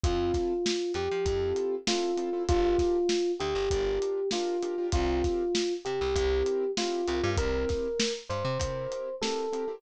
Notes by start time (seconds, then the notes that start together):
0.04 F2 C4 E4 F4 A4, kick, closed hi-hat
0.34 kick, snare, closed hi-hat
0.66 snare
0.94 F2 G4, closed hi-hat
1.11 F3
1.26 F2 C4 E4 F4 A4, kick, closed hi-hat
1.56 closed hi-hat
1.87 C4 E4 F4 A4, snare
2.17 C4 E4 F4 A4, closed hi-hat
2.33 C4 E4 F4 A4
2.48 G1 D4 F4 G4 A#4, kick, closed hi-hat
2.79 kick, snare, closed hi-hat
3.09 snare
3.40 D2 G4, closed hi-hat
3.55 G1
3.71 G1 D4 F4 G4 A#4, kick, closed hi-hat
4.02 closed hi-hat
4.31 D4 F4 G4 A#4, snare
4.63 D4 F4 G4 A#4, closed hi-hat
4.78 D4 F4 G4 A#4
4.92 C2 C4 F4 G4 A#4, kick, closed hi-hat
5.24 kick, snare, closed hi-hat
5.55 snare
5.85 C3 G4, closed hi-hat
6.01 C2
6.16 C2 C4 E4 G4 A#4, kick, closed hi-hat
6.46 closed hi-hat
6.77 C4 E4 F4 G4 A#4, snare
7.08 C2 C4 E4 G4 A#4, closed hi-hat
7.23 G2 C4 E4 G4 A#4
7.37 C2 C4 E4 G4 A#4, kick, closed hi-hat
7.69 kick, snare, closed hi-hat
8.00 snare
8.29 G2 C5, closed hi-hat
8.45 C3
8.59 C3 C4 E4 G4 A#4, kick, closed hi-hat
8.92 closed hi-hat
9.22 C4 E4 G4 A4 A#4, snare
9.53 C4 E4 G4 A#4, closed hi-hat
9.68 C4 E4 G4 A#4